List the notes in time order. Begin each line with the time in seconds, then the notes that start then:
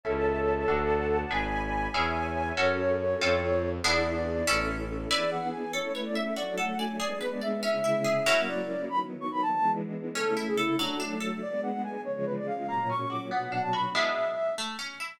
0.03 C#2 C#4 E4 A4 C#5 E5 A5
0.67 D2 D4 F#4 A4 D5 F#5 A5
1.30 G#1 D4 G#4 B4 D5 G#5 B5
1.94 E2 C#4 E4 G#4 C#5 E5 G#5
2.57 F#2 C#4 F#4 A4 C#5
3.20 F2 C4 F4 A4
3.84 E2 B3 D4 E4 G#4 D5
4.15 D5
4.46 A1 C#4 E4 A4
5.10 E3 B3 D4 E4 G#4 B4 D5 G#5
5.31 F#5
5.52 G#5
5.73 A3 C#4 E4 A4 C#5
5.94 B4 C#5
6.05 D5
6.15 E5
6.36 F#3 A3 D4 F#4 D5
6.57 A4 F#5
6.78 D5 G#5
6.99 G#3 B3 D4 G#4 D5
7.20 B4
7.31 D5
7.41 D5 E5
7.62 C#3 G#3 C#4 E4 E5
7.84 E4
8.04 G#4
8.26 F#3 A#3 C#4 E4 A#4
8.47 D5
8.88 D#3 F#3 B3 B5
9.21 C#6
9.31 B5
9.42 A5
9.53 E3 G#3 B3 D4
10.15 C#3 A3 C#4 E4 A4
10.36 E4
10.47 G#4
10.57 E4 A4
10.78 F#3 A3 D4
10.99 D4
11.20 A4
11.41 G#3 B3 D4 D5
11.63 F#5
11.84 G#5
12.05 C#3 F3 G#3 C#5
12.26 B4
12.36 D5
12.47 F5
12.68 A#2 F#3 A#3 C#4 A#5
12.89 C#4 C#6
13.10 F#4 D6
13.31 B2 F#3 B3 D4 F#5
13.52 D4 F#5
13.63 A5
13.73 F#4 B5
13.94 G#3 B3 D4 E4 E5
14.58 A3
14.79 C#4
15.00 E4